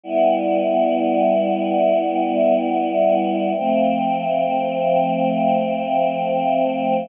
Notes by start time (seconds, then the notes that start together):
0.04 G3 B3 E4
3.57 F3 A3 C4